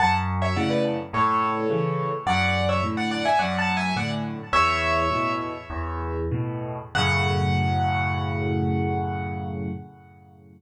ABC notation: X:1
M:4/4
L:1/16
Q:1/4=106
K:F#m
V:1 name="Acoustic Grand Piano"
[fa] z2 [ce] [df] [Bd] z2 [Ac]8 | [df]3 [ce] z [df] [df] [eg] (3[df]2 [fa]2 [eg]2 [df] z3 | "^rit." [ce]6 z10 | f16 |]
V:2 name="Acoustic Grand Piano" clef=bass
F,,4 [A,,C,]4 A,,4 [C,E,]4 | F,,4 [A,,D,]4 F,,4 [A,,D,]4 | "^rit." E,,4 [A,,B,,]4 E,,4 [A,,B,,]4 | [F,,A,,C,]16 |]